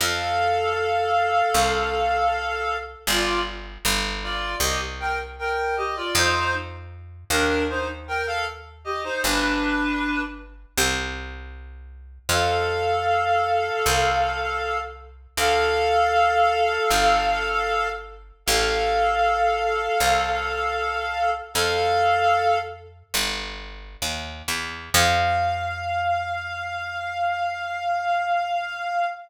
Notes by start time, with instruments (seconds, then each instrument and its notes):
0.00 electric bass (finger) F2, clarinet A4 F5
1.54 electric bass (finger) C2
3.07 electric bass (finger) G1, clarinet F4 D5
3.85 electric bass (finger) G1
4.23 clarinet F4 D5
4.60 electric bass (finger) C2, clarinet G4 D#5
5.00 clarinet A#4 G5
5.39 clarinet A#4 G5
5.77 clarinet G4 D#5
5.96 clarinet F4 D5
6.15 electric bass (finger) F2, clarinet D#4 C5
7.30 electric bass (finger) D#2, clarinet D4 A#4
7.69 clarinet D#4 C5
8.08 clarinet A#4 G5
8.27 clarinet A4 F5
8.84 clarinet G4 D#5
9.04 clarinet D#4 C5
9.23 electric bass (finger) G1, clarinet D4 B4
10.78 electric bass (finger) C2
12.29 electric bass (finger) F2, clarinet A4 F5
13.86 electric bass (finger) C2
15.37 electric bass (finger) D2, clarinet A4 F5
16.91 electric bass (finger) G1
18.46 electric bass (finger) A1, clarinet A4 F5
20.00 electric bass (finger) C2
21.54 electric bass (finger) F2, clarinet A4 F5
23.14 electric bass (finger) G1
24.02 electric bass (finger) D#2
24.48 electric bass (finger) E2
24.94 electric bass (finger) F2, clarinet F5